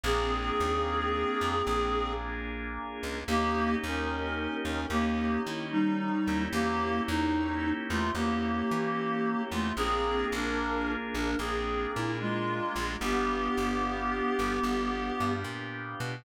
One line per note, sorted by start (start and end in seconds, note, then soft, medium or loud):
0.04 0.51 A#1 loud
0.04 1.56 A#3 medium
0.04 2.12 C4 medium
0.04 1.56 D4 medium
0.04 1.56 F4 medium
0.04 2.12 G#4 medium
0.04 1.56 G#4 medium
0.60 1.24 D#2 medium
1.41 1.62 F2 medium
1.66 2.79 A#1 medium
1.66 3.19 A#3 medium
1.66 3.19 D4 medium
1.66 3.19 F4 medium
1.66 3.19 G#4 medium
3.03 3.24 C#2 medium
3.28 3.76 D#2 loud
3.28 3.75 A#3 medium
3.28 4.80 A#3 medium
3.28 4.80 C#4 medium
3.28 4.80 D#4 loud
3.28 3.75 G4 medium
3.28 4.80 G4 loud
3.83 4.48 D#2 medium
3.83 4.55 C#4 medium
3.83 4.55 A#4 medium
4.65 4.86 D#2 medium
4.65 4.86 C#4 medium
4.65 4.86 A#4 medium
4.90 5.38 D#2 medium
4.90 5.41 A#3 medium
4.90 6.20 A#3 medium
4.90 6.20 C#4 medium
4.90 6.20 D#4 medium
4.90 5.41 G4 medium
4.90 6.20 G4 medium
5.46 6.11 D#3 medium
5.46 5.67 E4 medium
5.71 6.44 G3 medium
5.71 6.44 D#4 medium
6.27 6.48 D#2 medium
6.27 8.05 A#3 loud
6.27 8.05 C#4 medium
6.27 8.05 E4 loud
6.27 8.05 G4 medium
6.53 7.00 E2 loud
6.53 7.01 A#3 medium
6.53 7.01 G4 medium
7.08 7.72 E2 loud
7.08 7.71 D#4 medium
7.90 8.11 E2 loud
7.90 8.12 A3 medium
7.90 8.12 F4 medium
8.15 8.63 E2 medium
8.15 9.42 A#3 medium
8.15 9.68 A#3 medium
8.15 9.68 C#4 medium
8.15 9.68 E4 medium
8.15 9.42 G4 medium
8.15 9.68 G4 medium
8.71 9.35 E3 medium
9.51 9.72 E2 medium
9.51 9.72 A3 medium
9.51 9.72 F4 medium
9.77 10.25 A#1 loud
9.77 11.30 A#3 loud
9.77 10.26 C4 medium
9.77 11.30 D4 medium
9.77 11.30 F4 loud
9.77 10.26 G#4 medium
9.77 11.30 G#4 medium
10.32 10.96 A#1 loud
10.32 10.92 D4 medium
10.32 10.92 A#4 medium
11.14 11.35 A#1 medium
11.14 11.36 D4 medium
11.14 11.36 A#4 medium
11.39 11.87 A#1 medium
11.39 12.91 A#3 medium
11.39 11.91 C4 medium
11.39 12.91 D4 medium
11.39 12.91 F4 medium
11.39 11.91 G#4 medium
11.39 12.91 G#4 medium
11.95 12.60 A#2 medium
11.95 12.18 E4 medium
12.20 12.94 G#3 medium
12.20 12.94 F4 medium
12.76 12.97 A#1 loud
13.01 13.49 G1 loud
13.01 14.53 B3 loud
13.01 15.33 B3 medium
13.01 14.53 D4 loud
13.01 14.53 F4 loud
13.01 14.53 G4 medium
13.01 15.33 G4 medium
13.57 14.22 G1 medium
14.39 14.60 G1 medium
14.63 15.11 G1 medium
14.63 16.15 B3 medium
14.63 16.15 D4 medium
14.63 16.15 F4 medium
14.63 16.15 G4 medium
15.20 15.44 G2 medium
15.44 15.95 A#2 medium
16.00 16.22 B2 medium